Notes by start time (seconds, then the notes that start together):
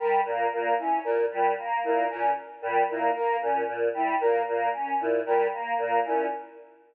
0.00 G3 A#4
0.25 A#2 A#3
0.53 A#2 A#3
0.78 C#4 E4
1.04 A#2 A#4
1.31 A#2 G3
1.59 A#3
1.84 A#2 A#3 E4
2.10 A#2 C#4 A#4
2.62 A#2 G3
2.89 A#2 A#3 E4
3.15 A#3 A#4
3.41 A#2 C#4
3.68 A#2
3.94 G3 E4
4.21 A#2 A#3 A#4
4.48 A#2 A#3
4.73 C#4
5.00 A#2 E4
5.26 A#2 G3 A#4
5.53 A#3
5.78 A#2 A#3
6.04 A#2 C#4 E4